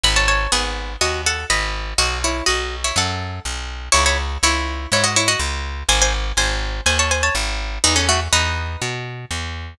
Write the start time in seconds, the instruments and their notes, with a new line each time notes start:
0.04 electric bass (finger) G#1, pizzicato strings D#5 B5
0.16 pizzicato strings C#5 A5
0.28 pizzicato strings C#5 A5
0.52 electric bass (finger) G#1, pizzicato strings B3 G#4
1.01 electric bass (finger) D#2, pizzicato strings F#4 D#5
1.26 pizzicato strings A4 F#5
1.50 electric bass (finger) G#1, pizzicato strings D#5 B5
1.98 electric bass (finger) B1, pizzicato strings F#4 D#5
2.24 pizzicato strings E4 C#5
2.46 electric bass (finger) B1, pizzicato strings F#4 D#5
2.84 pizzicato strings E4 C#5
2.96 electric bass (finger) F#2, pizzicato strings A4 F#5
3.45 electric bass (finger) B1
3.92 electric bass (finger) C#2, pizzicato strings E4 C#5
4.06 pizzicato strings E4 C#5
4.43 electric bass (finger) C#2, pizzicato strings E4 C#5
4.92 electric bass (finger) G#2, pizzicato strings E4 C#5
5.04 pizzicato strings F#4 D#5
5.16 pizzicato strings E4 C#5
5.28 pizzicato strings F#4 D#5
5.39 electric bass (finger) C#2
5.89 electric bass (finger) G#1, pizzicato strings C5 G#5
6.02 pizzicato strings C5 G#5
6.37 electric bass (finger) G#1, pizzicato strings C5 G#5
6.86 electric bass (finger) D#2, pizzicato strings C5 G#5
6.99 pizzicato strings C#5 A5
7.11 pizzicato strings C5 G#5
7.23 pizzicato strings C#5 A5
7.35 electric bass (finger) G#1
7.84 electric bass (finger) E2, pizzicato strings D#4 B4
7.96 pizzicato strings C#4 A4
8.09 pizzicato strings A3 F#4
8.33 electric bass (finger) E2, pizzicato strings D#4 B4
8.82 electric bass (finger) B2
9.31 electric bass (finger) E2